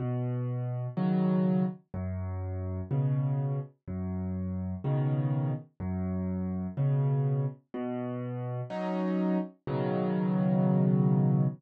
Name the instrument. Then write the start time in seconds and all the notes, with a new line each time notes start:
acoustic grand piano
0.00 B2
0.97 C#3 D#3 F#3
1.94 F#2
2.91 B2 C#3
3.88 F#2
4.84 B2 C#3 D#3
5.80 F#2
6.77 B2 C#3
7.74 B2
8.70 F#3 C#4 D#4
9.67 B2 C#3 D#3 F#3